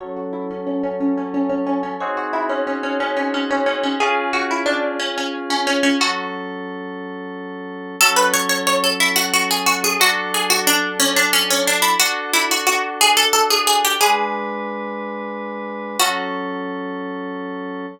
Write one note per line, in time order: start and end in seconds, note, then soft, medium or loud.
0.00 1.96 F#3 medium
0.00 1.96 C#4 medium
0.00 1.96 A4 medium
0.00 0.16 C#5 loud
0.16 0.32 F#4 medium
0.33 0.49 E4 medium
0.51 0.66 C#4 medium
0.67 0.82 C#4 medium
0.83 0.99 C#4 medium
1.00 1.16 C#4 medium
1.18 1.33 C#4 medium
1.34 1.49 C#4 medium
1.49 1.65 C#4 medium
1.67 1.82 C#4 medium
1.83 1.99 C#4 medium
2.00 3.96 C4 medium
2.00 3.96 D#4 medium
2.00 3.96 F#4 medium
2.00 3.96 G#4 loud
2.00 2.16 C#5 medium
2.17 2.33 F#4 medium
2.33 2.49 E4 medium
2.49 2.65 C#4 medium
2.67 2.83 C#4 medium
2.83 2.99 C#4 medium
3.00 3.16 C#4 medium
3.17 3.33 C#4 medium
3.34 3.50 C#4 medium
3.51 3.66 C#4 medium
3.66 3.82 C#4 medium
3.83 3.99 C#4 medium
4.00 5.96 C#4 loud
4.00 5.96 F4 medium
4.00 5.96 G#4 medium
4.00 4.29 G#4 loud
4.33 4.49 F#4 medium
4.51 4.67 E4 medium
4.66 4.98 D4 medium
4.99 5.15 C#4 medium
5.18 5.33 C#4 medium
5.50 5.66 C#4 medium
5.67 5.83 C#4 medium
5.83 5.99 C#4 medium
6.00 7.96 F#3 medium
6.00 7.96 C#4 medium
6.00 6.60 F#4 loud
6.00 7.96 A4 medium
8.01 9.97 F#3 loud
8.01 9.97 C#4 loud
8.01 8.17 A4 loud
8.01 9.97 A4 loud
8.16 8.32 B4 medium
8.34 8.49 C#5 loud
8.49 8.65 C#5 medium
8.67 8.83 C#5 medium
8.84 9.00 A4 medium
9.00 9.16 E4 medium
9.16 9.32 F#4 loud
9.33 9.49 F#4 medium
9.51 9.67 G#4 loud
9.66 9.82 F#4 loud
9.84 10.00 G#4 loud
9.99 11.95 F#3 medium
9.99 11.95 D4 loud
9.99 10.32 F#4 loud
9.99 11.95 A4 loud
10.34 10.50 G#4 medium
10.50 10.66 F#4 loud
10.67 10.95 D4 loud
11.00 11.15 C#4 loud
11.16 11.32 D4 medium
11.33 11.49 C#4 loud
11.50 11.66 C#4 medium
11.67 11.83 D4 medium
11.82 11.98 E4 medium
12.00 13.96 D4 medium
12.00 12.29 F#4 loud
12.00 13.96 F#4 medium
12.00 13.96 A4 medium
12.33 12.49 E4 medium
12.51 12.66 F#4 medium
12.67 12.97 F#4 loud
13.01 13.17 G#4 loud
13.17 13.33 A4 loud
13.33 13.49 A4 loud
13.50 13.66 G#4 medium
13.67 13.83 G#4 loud
13.85 14.00 G4 loud
14.01 15.97 G#3 loud
14.01 15.97 D4 medium
14.01 14.82 G#4 loud
14.01 15.97 B4 loud
15.99 17.86 F#3 medium
15.99 17.86 C#4 loud
15.99 17.86 F#4 loud
15.99 17.86 A4 loud